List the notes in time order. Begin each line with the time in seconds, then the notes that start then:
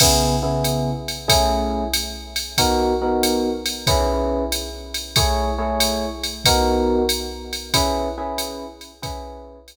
0.00 C#3 B3 E4 G#4, kick, crash, ride
0.43 C#3 B3 E4 G#4
0.64 hi-hat pedal, ride
1.08 ride
1.28 A3 C#4 E4 G#4, kick, ride
1.94 hi-hat pedal, ride
2.36 ride
2.58 B3 D#4 F#4 A#4, kick, ride
3.02 B3 D#4 F#4 A#4
3.23 hi-hat pedal, ride
3.66 ride
3.87 C#4 E4 G#4 B4, kick, ride
4.52 hi-hat pedal, ride
4.94 ride
5.16 A3 E4 G#4 C#5, kick, ride
5.58 A3 E4 G#4 C#5
5.80 hi-hat pedal, ride
6.24 ride
6.45 B3 D#4 F#4 A#4, kick, ride
7.09 hi-hat pedal, ride
7.53 ride
7.74 C#4 E4 G#4 B4, kick, ride
8.18 C#4 E4 G#4 B4
8.38 hi-hat pedal, ride
8.81 ride
9.02 C#4 E4 G#4 B4, kick, ride
9.68 hi-hat pedal, ride